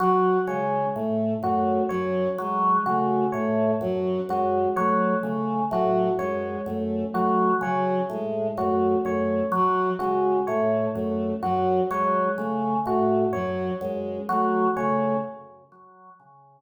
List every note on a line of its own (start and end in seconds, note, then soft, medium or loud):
0.00 0.38 F#3 medium
0.00 0.37 F#4 medium
0.47 0.86 C#3 medium
0.47 0.86 G#3 medium
0.47 0.86 C#5 medium
0.95 1.34 A2 medium
0.95 1.34 A3 medium
1.43 1.81 F#2 medium
1.43 1.81 A3 medium
1.43 1.82 F#4 medium
1.89 2.29 F#2 medium
1.89 2.27 F#3 medium
1.89 2.27 C#5 medium
2.38 2.77 F#3 medium
2.38 2.78 G#3 medium
2.86 3.24 C#3 medium
2.86 3.25 A3 medium
2.86 3.24 F#4 medium
3.32 3.72 A2 medium
3.32 3.73 A3 medium
3.32 3.70 C#5 medium
3.81 4.19 F#2 medium
3.81 4.20 F#3 medium
4.28 4.67 F#2 medium
4.28 4.66 G#3 medium
4.28 4.68 F#4 medium
4.76 5.15 F#3 medium
4.76 5.14 A3 medium
4.76 5.14 C#5 medium
5.22 5.61 C#3 medium
5.22 5.60 A3 medium
5.70 6.09 A2 medium
5.70 6.09 F#3 medium
5.70 6.11 F#4 medium
6.19 6.57 F#2 medium
6.19 6.58 G#3 medium
6.19 6.57 C#5 medium
6.65 7.04 F#2 medium
6.65 7.04 A3 medium
7.12 7.53 F#3 medium
7.12 7.50 A3 medium
7.12 7.52 F#4 medium
7.61 7.99 C#3 medium
7.61 8.00 F#3 medium
7.61 8.01 C#5 medium
8.10 8.48 A2 medium
8.10 8.50 G#3 medium
8.57 8.95 F#2 medium
8.57 8.95 A3 medium
8.57 8.96 F#4 medium
9.04 9.43 F#2 medium
9.04 9.42 A3 medium
9.04 9.44 C#5 medium
9.52 9.90 F#3 medium
9.52 9.92 F#3 medium
9.99 10.38 C#3 medium
9.99 10.37 G#3 medium
9.99 10.37 F#4 medium
10.47 10.86 A2 medium
10.47 10.87 A3 medium
10.47 10.85 C#5 medium
10.94 11.34 F#2 medium
10.94 11.32 A3 medium
11.43 11.81 F#2 medium
11.43 11.81 F#3 medium
11.43 11.81 F#4 medium
11.90 12.29 F#3 medium
11.90 12.28 G#3 medium
11.90 12.29 C#5 medium
12.37 12.76 C#3 medium
12.37 12.75 A3 medium
12.86 13.24 A2 medium
12.86 13.24 A3 medium
12.86 13.25 F#4 medium
13.33 13.71 F#2 medium
13.33 13.72 F#3 medium
13.33 13.71 C#5 medium
13.81 14.19 F#2 medium
13.81 14.19 G#3 medium
14.29 14.67 F#3 medium
14.29 14.67 A3 medium
14.29 14.67 F#4 medium
14.76 15.15 C#3 medium
14.76 15.14 A3 medium
14.76 15.15 C#5 medium